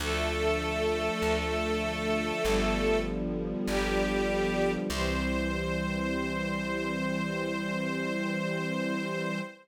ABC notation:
X:1
M:4/4
L:1/8
Q:1/4=49
K:C
V:1 name="String Ensemble 1"
[A,A]6 [G,G]2 | c8 |]
V:2 name="String Ensemble 1"
[D,F,A,]4 [D,F,G,B,]4 | [E,G,C]8 |]
V:3 name="Electric Bass (finger)" clef=bass
D,,2 D,,2 G,,,2 G,,,2 | C,,8 |]